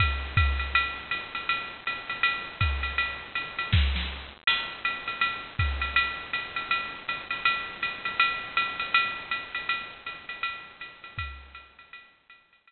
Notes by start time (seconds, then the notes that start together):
0.00 kick, ride
0.37 kick, hi-hat pedal, ride
0.59 ride
0.75 ride
1.11 hi-hat pedal, ride
1.35 ride
1.49 ride
1.87 hi-hat pedal, ride
2.09 ride
2.23 ride
2.61 kick, hi-hat pedal, ride
2.83 ride
2.98 ride
3.35 hi-hat pedal, ride
3.59 ride
3.72 kick, snare
3.96 snare
4.47 crash, ride
4.85 hi-hat pedal, ride
5.08 ride
5.21 ride
5.59 kick, hi-hat pedal, ride
5.81 ride
5.96 ride
6.33 hi-hat pedal, ride
6.56 ride
6.71 ride
7.08 hi-hat pedal, ride
7.31 ride
7.45 ride
7.82 hi-hat pedal, ride
8.05 ride
8.20 ride
8.57 hi-hat pedal, ride
8.80 ride
8.94 ride
9.31 hi-hat pedal, ride
9.55 ride
9.69 ride
10.06 hi-hat pedal, ride
10.29 ride
10.43 ride
10.80 hi-hat pedal, ride
11.04 ride
11.18 kick, ride
11.55 hi-hat pedal, ride
11.79 ride
11.93 ride
12.30 hi-hat pedal, ride
12.53 ride
12.67 ride